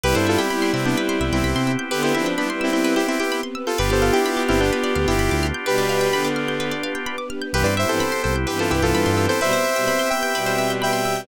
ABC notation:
X:1
M:4/4
L:1/16
Q:1/4=128
K:C
V:1 name="Lead 2 (sawtooth)"
[GB] [Ac] [FA] [EG]3 [CE] [B,D] z3 [CE]4 z | [GB] [EG] [CE] z [B,D] z [CE] [CE]2 [EG] [CE] [EG]2 z2 [FA] | [GB] [Ac] [FA] [EG]3 [CE] [B,D] z3 [EG]4 z | [GB]6 z10 |
[GB] [Bd] [ce] [Ac]3 [Ac] z [GB] [FA] [EG] [FA]4 [Ac] | [ce]6 [eg]6 [eg]4 |]
V:2 name="Violin"
[G,E]4 [G,E]8 z4 | [D,B,]2 [F,D]2 [G,E] [G,E]5 z6 | [B,G]4 [B,G]8 z4 | [B,,G,]4 [D,B,]6 z6 |
[G,,E,] z2 [G,,E,] z4 [G,,E,]8 | [B,,G,] z2 [B,,G,] z4 [B,,G,]8 |]
V:3 name="Drawbar Organ"
[B,CEG]16- | [B,CEG]16 | [B,DFG]16- | [B,DFG]16 |
[B,CEG]16- | [B,CEG]16 |]
V:4 name="Pizzicato Strings"
B c e g b c' e' g' B c e g b c' e' g' | B c e g b c' e' g' B c e g b c' e' g' | B d f g b d' f' g' B d f g b d' f' g' | B d f g b d' f' g' B d f g b d' f' g' |
B c e g b c' e' g' B c e g b c' e' g' | B c e g b c' e' g' B c e g b c' e' g' |]
V:5 name="Synth Bass 1" clef=bass
C,, G,,5 C,4 C,, C,, C,, C,3- | C,16 | G,,, G,,,5 G,,,4 D,, G,,, G,,, D,,3- | D,,16 |
C,, G,,5 C,,4 C,, C,, G,, G,,3- | G,,16 |]
V:6 name="String Ensemble 1"
[B,CEG]16 | [B,CGB]16 | [B,DFG]16 | [B,DGB]16 |
[B,CEG]16 | [B,CGB]16 |]